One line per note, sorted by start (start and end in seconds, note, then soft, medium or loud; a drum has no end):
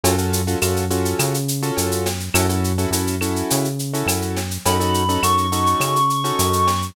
0.03 0.55 F#2 loud
0.03 0.16 C#4 medium
0.03 0.16 F4 loud
0.03 0.16 F#4 loud
0.03 0.16 A4 medium
0.03 cowbell loud
0.03 shaker loud
0.18 0.41 C#4 medium
0.18 0.41 F4 medium
0.18 0.41 F#4 medium
0.18 0.41 A4 medium
0.18 shaker medium
0.33 shaker medium
0.47 0.59 C#4 medium
0.47 0.59 F4 medium
0.47 0.59 F#4 medium
0.47 0.59 A4 medium
0.47 shaker medium
0.62 1.14 F#2 loud
0.62 0.85 C#4 medium
0.62 0.85 F4 medium
0.62 0.85 F#4 medium
0.62 0.85 A4 medium
0.62 claves medium
0.62 shaker loud
0.76 shaker medium
0.90 1.37 C#4 medium
0.90 1.37 F4 medium
0.90 1.37 F#4 medium
0.90 1.37 A4 medium
0.90 shaker medium
1.05 shaker medium
1.19 1.71 C#3 loud
1.19 cowbell medium
1.19 claves medium
1.19 shaker loud
1.34 shaker medium
1.48 shaker medium
1.62 2.09 C#4 medium
1.62 2.09 F4 medium
1.62 2.09 F#4 medium
1.62 2.09 A4 medium
1.62 shaker medium
1.77 2.29 F#2 medium
1.77 cowbell medium
1.77 shaker loud
1.91 shaker medium
2.06 snare medium
2.06 cowbell medium
2.06 shaker medium
2.20 shaker medium
2.34 2.86 F#2 loud
2.34 2.46 C#4 loud
2.34 2.46 E4 medium
2.34 2.46 F#4 loud
2.34 2.46 A4 loud
2.34 cowbell medium
2.34 claves loud
2.34 shaker loud
2.49 2.72 C#4 medium
2.49 2.72 E4 medium
2.49 2.72 F#4 medium
2.49 2.72 A4 medium
2.49 shaker medium
2.64 shaker medium
2.78 2.90 C#4 medium
2.78 2.90 E4 medium
2.78 2.90 F#4 medium
2.78 2.90 A4 medium
2.78 shaker medium
2.91 3.43 F#2 medium
2.91 3.16 C#4 medium
2.91 3.16 E4 medium
2.91 3.16 F#4 medium
2.91 3.16 A4 medium
2.91 shaker loud
3.07 shaker medium
3.21 3.67 C#4 medium
3.21 3.67 E4 medium
3.21 3.67 F#4 medium
3.21 3.67 A4 medium
3.21 claves medium
3.21 shaker medium
3.36 shaker medium
3.50 4.03 C#3 medium
3.50 cowbell medium
3.50 shaker loud
3.65 shaker medium
3.79 shaker medium
3.93 4.40 C#4 medium
3.93 4.40 E4 medium
3.93 4.40 F#4 medium
3.93 4.40 A4 medium
3.93 shaker medium
4.06 4.58 F#2 medium
4.06 cowbell medium
4.06 claves medium
4.06 shaker loud
4.22 shaker medium
4.36 snare medium
4.36 cowbell medium
4.36 shaker medium
4.51 shaker medium
4.65 5.18 F#2 loud
4.65 4.77 C#4 medium
4.65 4.77 D#4 medium
4.65 4.77 F#4 medium
4.65 4.77 A4 loud
4.65 5.23 B5 medium
4.65 cowbell medium
4.65 shaker loud
4.80 5.03 C#4 medium
4.80 5.03 D#4 medium
4.80 5.03 F#4 medium
4.80 5.03 A4 medium
4.80 shaker medium
4.94 shaker medium
5.09 5.20 C#4 medium
5.09 5.20 D#4 medium
5.09 5.20 F#4 medium
5.09 5.20 A4 medium
5.09 shaker medium
5.23 5.75 F#2 loud
5.23 5.46 C#4 medium
5.23 5.46 D#4 medium
5.23 5.46 F#4 medium
5.23 5.46 A4 medium
5.23 6.86 C#6 medium
5.23 claves medium
5.23 shaker loud
5.38 shaker medium
5.52 5.98 C#4 medium
5.52 5.98 D#4 medium
5.52 5.98 F#4 medium
5.52 5.98 A4 medium
5.52 shaker medium
5.66 shaker medium
5.80 6.32 C#3 medium
5.80 cowbell medium
5.80 claves medium
5.80 shaker medium
5.96 shaker medium
6.10 shaker medium
6.24 6.70 C#4 medium
6.24 6.70 D#4 medium
6.24 6.70 F#4 medium
6.24 6.70 A4 medium
6.24 shaker medium
6.39 6.91 F#2 loud
6.39 cowbell medium
6.39 shaker loud
6.53 shaker medium
6.67 snare medium
6.67 cowbell medium
6.67 shaker medium
6.82 shaker medium